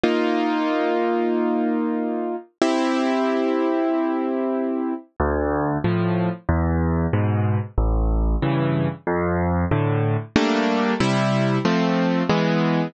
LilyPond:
\new Staff { \time 4/4 \key d \minor \tempo 4 = 93 <bes ees' f'>1 | <c' e' g'>1 | d,4 <a, f>4 e,4 <gis, b,>4 | a,,4 <g, cis e>4 f,4 <a, d>4 |
<g a bes d'>4 <c g e'>4 <f a c'>4 <e gis b>4 | }